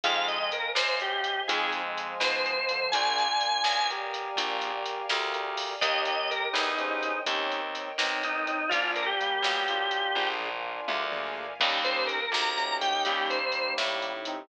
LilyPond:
<<
  \new Staff \with { instrumentName = "Drawbar Organ" } { \time 12/8 \key ees \major \tempo 4. = 83 f''8 ees''8 bes'8 c''8 g'4 aes'8 r4 c''4. | aes''2~ aes''8 r2. r8 | ees''8 ees''8 bes'8 ees'4. r2 ees'8 ees'8 | f'8 bes'16 g'2~ g'8. r2 r8 |
r8 c''8 bes'8 bes''4 g''8 g'8 c''4 r4. | }
  \new Staff \with { instrumentName = "Brass Section" } { \time 12/8 \key ees \major <f aes>4 r2 <f aes>2~ <f aes>8 <d f>8 | <d' f'>2 <g' bes'>2~ <g' bes'>8 <g' bes'>8 <g' bes'>4 | <g' bes'>2 <aes' c''>4 <c' ees'>4. <c' ees'>8 <c' ees'>4 | <bes d'>4 <g bes>8 <g bes>8 <d' f'>2. r4 |
<g bes>4 r2 <g bes>2~ <g bes>8 <c' ees'>8 | }
  \new Staff \with { instrumentName = "Acoustic Grand Piano" } { \time 12/8 \key ees \major <c' ees' f' aes'>2. <c' ees' f' aes'>4. <c' ees' f' aes'>4. | <bes d' f' aes'>2. <bes d' f' aes'>2. | <bes des' ees' g'>2 <bes des' ees' g'>4 <bes des' ees' g'>2. | <bes d' f' aes'>4. <bes d' f' aes'>4. <bes d' f' aes'>4. <bes d' f' aes'>8 <bes d' f' aes'>4 |
<bes des' ees' g'>8 <bes des' ees' g'>4. <bes des' ees' g'>8 <bes des' ees' g'>2.~ <bes des' ees' g'>8 | }
  \new Staff \with { instrumentName = "Electric Bass (finger)" } { \clef bass \time 12/8 \key ees \major f,4. ges,4. f,4. b,4. | bes,,4. b,,4. bes,,4. d,4. | ees,4. e,4. ees,4. b,,4. | bes,,4. b,,4. bes,,4. d,4. |
ees,4. d,4. ees,4. a,4. | }
  \new Staff \with { instrumentName = "String Ensemble 1" } { \time 12/8 \key ees \major <c'' ees'' f'' aes''>2. <c'' ees'' f'' aes''>2. | <bes' d'' f'' aes''>2. <bes' d'' f'' aes''>2. | <bes' des'' ees'' g''>2. <bes' des'' ees'' g''>2. | <bes' d'' f'' aes''>2. <bes' d'' f'' aes''>2. |
<bes des' ees' g'>2. <bes des' ees' g'>2. | }
  \new DrumStaff \with { instrumentName = "Drums" } \drummode { \time 12/8 <hh bd>8 hh8 hh8 sn8 hh8 hh8 <hh bd>8 hh8 hh8 sn8 hh8 hh8 | <hh bd>8 hh8 hh8 sn8 hh8 hh8 <hh bd>8 hh8 hh8 sn8 hh8 hho8 | <hh bd>8 hh8 hh8 sn8 hh8 hh8 <hh bd>8 hh8 hh8 sn8 hh8 hh8 | <hh bd>8 hh8 hh8 sn8 hh8 hh8 <bd tommh>8 toml8 tomfh8 tommh8 toml8 tomfh8 |
<cymc bd>8 hh8 hh8 sn8 hh8 hh8 <hh bd>8 hh8 hh8 sn8 hh8 hh8 | }
>>